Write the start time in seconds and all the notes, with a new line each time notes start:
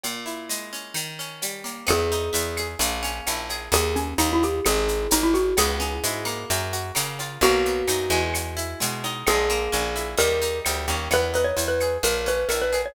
0.03 A#2, cowbell, shaker
0.26 E4, shaker
0.49 G#3, shaker
0.73 C#4, shaker
0.94 D#3, cowbell, claves, shaker
1.19 C#4, shaker
1.42 G3, cowbell, shaker
1.64 A#3, cowbell, shaker
1.87 E2 B3 G#4, cowbell, claves, shaker
2.11 D#4, shaker
2.33 E2 E4, shaker
2.57 G#4, claves, shaker
2.79 A#1 A#3, cowbell, shaker
3.03 C#4, shaker
3.26 A#1 E4, cowbell, claves, shaker
3.49 G#4, cowbell, shaker
3.72 D#2 G#4, cowbell, shaker
3.95 C#4, shaker
4.18 D#2 D#4, claves, shaker
4.32 E4
4.43 G4, shaker
4.65 G#1 G#4, cowbell, claves, shaker
4.88 shaker
5.11 G#1 D#4, cowbell, shaker
5.23 E4
5.34 F#4, cowbell, shaker
5.57 C#2 B3 G#4, cowbell, claves, shaker
5.80 C#4, shaker
6.03 G#2 E4, shaker
6.25 A#3, claves, shaker
6.50 F#2, cowbell, shaker
6.73 F#4, shaker
6.95 C#3 A#3, cowbell, claves, shaker
7.19 F4, cowbell, shaker
7.41 B1 A#3 F#4, cowbell, shaker
7.65 B3, shaker
7.87 F#2 D#4, claves, shaker
8.10 E2 G#3, shaker
8.34 cowbell, claves, shaker
8.57 E4, shaker
8.80 B2 G#3, cowbell, shaker
9.04 D#4, cowbell, shaker
9.26 A#1 G#3 G#4, cowbell, claves, shaker
9.50 A#3, shaker
9.72 A#1 C#4, shaker
9.96 E4, shaker
10.17 D#2 G3 A#4, cowbell, shaker
10.42 D#4, shaker
10.65 D2 G3, cowbell, claves, shaker
10.88 D#2 C#4, cowbell, shaker
11.11 E2 B3 B4, cowbell, claves, shaker
11.34 D#4 B4, shaker
11.44 C#5
11.57 E2 E4, shaker
11.67 B4
11.80 G#4, claves, shaker
12.03 A#1 A#3 A#4, cowbell, shaker
12.26 C#4 B4, shaker
12.48 A#1 E4 A#4, cowbell, claves, shaker
12.61 B4
12.72 G#4, cowbell, shaker
12.85 C#5